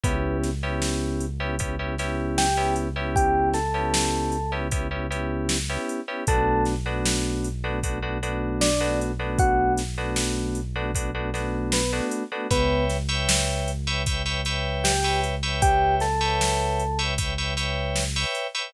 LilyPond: <<
  \new Staff \with { instrumentName = "Electric Piano 1" } { \time 4/4 \key b \minor \tempo 4 = 77 <b b'>8 r2 r8 <g' g''>8 r8 | <g' g''>8 <a' a''>4. r2 | <a' a''>8 r2 r8 <d' d''>8 r8 | <fis' fis''>8 r2 r8 <b b'>8 r8 |
<b b'>8 r2 r8 <g' g''>8 r8 | <g' g''>8 <a' a''>4. r2 | }
  \new Staff \with { instrumentName = "Electric Piano 2" } { \time 4/4 \key b \minor <b cis' e' g'>8. <b cis' e' g'>4 <b cis' e' g'>16 <b cis' e' g'>16 <b cis' e' g'>16 <b cis' e' g'>8. <b cis' e' g'>8 <b cis' e' g'>16~ | <b cis' e' g'>8. <b cis' e' g'>4 <b cis' e' g'>16 <b cis' e' g'>16 <b cis' e' g'>16 <b cis' e' g'>8. <b cis' e' g'>8 <b cis' e' g'>16 | <a b d' fis'>8. <a b d' fis'>4 <a b d' fis'>16 <a b d' fis'>16 <a b d' fis'>16 <a b d' fis'>8. <a b d' fis'>8 <a b d' fis'>16~ | <a b d' fis'>8. <a b d' fis'>4 <a b d' fis'>16 <a b d' fis'>16 <a b d' fis'>16 <a b d' fis'>8. <a b d' fis'>8 <a b d' fis'>16 |
<b' cis'' e'' g''>8. <b' cis'' e'' g''>4 <b' cis'' e'' g''>16 <b' cis'' e'' g''>16 <b' cis'' e'' g''>16 <b' cis'' e'' g''>8. <b' cis'' e'' g''>8 <b' cis'' e'' g''>16~ | <b' cis'' e'' g''>8. <b' cis'' e'' g''>4 <b' cis'' e'' g''>16 <b' cis'' e'' g''>16 <b' cis'' e'' g''>16 <b' cis'' e'' g''>8. <b' cis'' e'' g''>8 <b' cis'' e'' g''>16 | }
  \new Staff \with { instrumentName = "Synth Bass 1" } { \clef bass \time 4/4 \key b \minor cis,1~ | cis,1 | b,,1~ | b,,1 |
cis,1~ | cis,1 | }
  \new DrumStaff \with { instrumentName = "Drums" } \drummode { \time 4/4 <hh bd>8 <hh sn>8 sn8 hh8 <hh bd>8 <hh sn>8 sn8 hh8 | <hh bd>8 <hh sn>8 sn8 hh8 <hh bd>8 hh8 sn8 hh8 | <hh bd>8 <hh sn>8 sn8 hh8 <hh bd>8 hh8 sn8 hh8 | <hh bd>8 <hh sn>8 sn8 hh8 <hh bd>8 <hh sn>8 sn8 hh8 |
<hh bd>8 <hh sn>8 sn8 hh8 <hh bd>8 hh8 sn8 hh8 | <hh bd>8 <hh sn>8 sn8 hh8 <hh bd>8 hh8 sn8 hh8 | }
>>